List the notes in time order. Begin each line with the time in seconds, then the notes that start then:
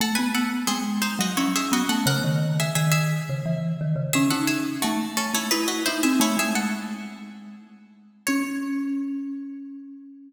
0.00 A3 A4 F#5
0.15 B3 B4 G#5
0.34 A4 F#5
0.67 G#3 C4 G#4
1.02 D#4 C5
1.19 F#3 F#4 D#5
1.37 C#4 E4 C#5
1.56 G#4 E5
1.72 B3 F#4 D#5
1.89 A3 A4 F#5
2.06 C#3 A#4 F#5
2.24 D#3
2.60 G#4 E5
2.75 D#3 G#4 E5
2.92 G#4 E5
3.29 C#3
3.46 E3
3.81 D#3
3.96 C#3
4.13 C#4 G#4 E5
4.30 D#4 A4 F#5
4.47 G#4 E5
4.82 A3 F#4
5.17 C#4 A4
5.34 A3 E4 C#5
5.51 D#4 E4 B4
5.68 F#4 D#5
5.86 D#4 E4 C5
6.03 C4 G#4 E5
6.20 A3 E4 C#5
6.37 G#3 G#4 E5
6.55 A4 F#5
8.27 C#4 C#5